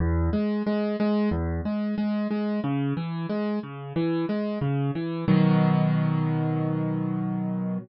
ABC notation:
X:1
M:4/4
L:1/8
Q:1/4=91
K:B
V:1 name="Acoustic Grand Piano" clef=bass
E,, G, G, G, E,, G, G, G, | C, E, G, C, E, G, C, E, | [B,,D,F,]8 |]